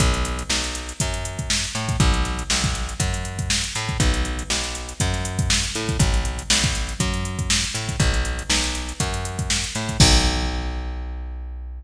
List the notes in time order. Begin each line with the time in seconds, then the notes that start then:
0.00 B1, kick, closed hi-hat
0.14 closed hi-hat
0.25 closed hi-hat
0.39 closed hi-hat
0.49 B1, snare
0.64 closed hi-hat
0.75 closed hi-hat
0.89 closed hi-hat
1.00 F#2, kick, closed hi-hat
1.14 closed hi-hat
1.25 closed hi-hat
1.39 kick, closed hi-hat
1.50 snare
1.64 closed hi-hat
1.75 A2, snare, closed hi-hat
1.89 kick, closed hi-hat
2.00 B1, kick, closed hi-hat
2.14 closed hi-hat
2.25 snare, closed hi-hat
2.39 closed hi-hat
2.50 B1, snare
2.64 kick, closed hi-hat
2.75 snare, closed hi-hat
2.89 closed hi-hat
3.00 F#2, kick, closed hi-hat
3.14 closed hi-hat
3.25 closed hi-hat
3.39 kick, closed hi-hat
3.50 snare
3.64 closed hi-hat
3.75 A2, closed hi-hat
3.89 kick, closed hi-hat
4.00 B1, kick, closed hi-hat
4.14 closed hi-hat
4.25 closed hi-hat
4.39 closed hi-hat
4.50 B1, snare
4.64 closed hi-hat
4.75 closed hi-hat
4.89 closed hi-hat
5.00 F#2, kick, closed hi-hat
5.14 snare, closed hi-hat
5.25 closed hi-hat
5.39 kick, closed hi-hat
5.50 snare
5.64 snare, closed hi-hat
5.75 A2, closed hi-hat
5.89 kick, closed hi-hat
5.99 B1, kick, closed hi-hat
6.14 closed hi-hat
6.25 closed hi-hat
6.39 closed hi-hat
6.50 B1, snare
6.64 kick, closed hi-hat
6.75 closed hi-hat
6.89 closed hi-hat
7.00 F#2, kick, closed hi-hat
7.14 closed hi-hat
7.25 closed hi-hat
7.39 kick, closed hi-hat
7.50 snare
7.64 closed hi-hat
7.74 A2, snare, closed hi-hat
7.89 kick, closed hi-hat
8.00 B1, kick, closed hi-hat
8.14 closed hi-hat
8.25 closed hi-hat
8.39 closed hi-hat
8.50 B1, snare
8.64 snare, closed hi-hat
8.75 closed hi-hat
8.89 closed hi-hat
9.00 F#2, kick, closed hi-hat
9.14 closed hi-hat
9.25 closed hi-hat
9.39 kick, closed hi-hat
9.50 snare
9.64 closed hi-hat
9.75 A2, snare, closed hi-hat
9.89 kick, closed hi-hat
10.00 B1, kick, crash